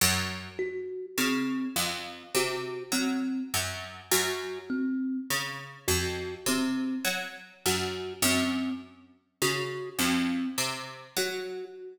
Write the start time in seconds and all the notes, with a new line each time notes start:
0.01 F#2
0.59 F#4
1.18 C#3 C4
1.76 F2
2.35 C3 F#4
2.92 F#3 C4
3.54 F#2
4.12 F#2 F#4
4.70 C4
5.30 C#3
5.88 F2 F#4
6.46 C3 C4
7.05 F#3
7.66 F#2 F#4
8.22 F#2 C4
9.42 C#3 F#4
9.99 F2 C4
10.58 C3
11.17 F#3 F#4